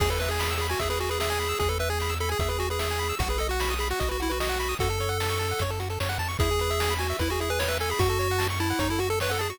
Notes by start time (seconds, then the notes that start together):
0.00 E2 G#4, kick, crash
0.10 A4 B4, closed hi-hat
0.19 B4 E5, closed hi-hat
0.29 G#4 G#5, closed hi-hat
0.39 B5, snare
0.50 E6, closed hi-hat
0.58 G#4 B5, closed hi-hat
0.69 F#4 G#5, closed hi-hat
0.79 E2 G#4 E5, kick, closed hi-hat
0.90 G#4 B4, closed hi-hat
1.00 F#4 G#4, closed hi-hat
1.09 G#4 B4, closed hi-hat
1.20 G#4 E5, snare
1.30 G#5, closed hi-hat
1.40 B5, closed hi-hat
1.49 E6, closed hi-hat
1.59 E2 G#4, kick, closed hi-hat
1.69 A4 B4, closed hi-hat
1.79 B4 E5, closed hi-hat
1.90 G#4 G#5, closed hi-hat
2.00 B5, snare
2.09 E6, closed hi-hat
2.20 A4 B5, closed hi-hat
2.29 G#4 G#5, closed hi-hat
2.39 E2 G#4 E5, kick, closed hi-hat
2.49 G#4 B4, closed hi-hat
2.59 F#4 G#4, closed hi-hat
2.70 G#4 B4, closed hi-hat
2.79 G#4 E5, snare
2.90 G#5, closed hi-hat
2.99 B5, closed hi-hat
3.09 E6, closed hi-hat
3.19 B1 F#4, kick, closed hi-hat
3.29 G#4 B4, closed hi-hat
3.38 A4 D#5, closed hi-hat
3.49 F#4 F#5, closed hi-hat
3.60 B5, snare
3.70 D#6, closed hi-hat
3.79 G#4 B5, closed hi-hat
3.90 F#4 F#5, closed hi-hat
4.00 B1 F#4 D#5, kick, closed hi-hat
4.09 F#4 B4, closed hi-hat
4.20 E4 F#4, closed hi-hat
4.30 F#4 B4, closed hi-hat
4.40 F#4 D#5, snare
4.49 F#5, closed hi-hat
4.60 B5, closed hi-hat
4.69 D#6, open hi-hat
4.79 F#2 F#4 A4, kick, closed hi-hat
4.89 A4, closed hi-hat
5.00 C#5, closed hi-hat
5.09 F#5, closed hi-hat
5.20 A5, snare
5.29 C#6, closed hi-hat
5.39 A5, closed hi-hat
5.49 F#5, closed hi-hat
5.59 F#2 C#5, kick, closed hi-hat
5.70 A4, closed hi-hat
5.80 F#4, closed hi-hat
5.90 A4, closed hi-hat
6.00 F#2 C#5, snare
6.09 F#5, closed hi-hat
6.19 F2 A5, closed hi-hat
6.28 C#6, closed hi-hat
6.39 E2 E4 G#4, kick, closed hi-hat
6.51 G#4, closed hi-hat
6.59 B4, closed hi-hat
6.70 E5, closed hi-hat
6.80 G#5, snare
6.90 B5, closed hi-hat
6.99 F#4 G#5, closed hi-hat
7.10 E5, closed hi-hat
7.19 E2 E4 B4, kick, closed hi-hat
7.30 F#4 G#4, closed hi-hat
7.40 E4 G#4, closed hi-hat
7.49 G#4 B4, closed hi-hat
7.59 B4 C#5, snare
7.68 B4 E5, closed hi-hat
7.80 A4 G#5, closed hi-hat
7.90 G#4 B5, open hi-hat
7.99 F#2 F#4, kick, closed hi-hat
8.09 A4, closed hi-hat
8.19 C#5, closed hi-hat
8.30 F#5, closed hi-hat
8.38 A5, snare
8.49 C#6, closed hi-hat
8.60 E4 A5, closed hi-hat
8.70 F#5, closed hi-hat
8.79 F#2 D#4 C#5, kick, closed hi-hat
8.89 E4 A4, closed hi-hat
8.99 F#4, closed hi-hat
9.10 A4, closed hi-hat
9.20 B4 C#5, snare
9.29 A4 F#5, closed hi-hat
9.39 G#4 A5, closed hi-hat
9.50 F#4 C#6, closed hi-hat